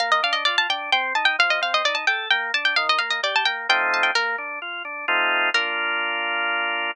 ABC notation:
X:1
M:3/4
L:1/16
Q:1/4=130
K:Bb
V:1 name="Harpsichord"
f e f e d a g2 g2 a g | f e f e d a g2 g2 a g | f e f e d a g2 g2 a g | B10 z2 |
B12 |]
V:2 name="Drawbar Organ"
B,2 D2 F2 D2 C2 E2 | F,2 C2 E2 A2 B,2 D2 | E,2 B,2 G2 B,2 [F,A,CE]4 | B,2 D2 F2 D2 [A,CEF]4 |
[B,DF]12 |]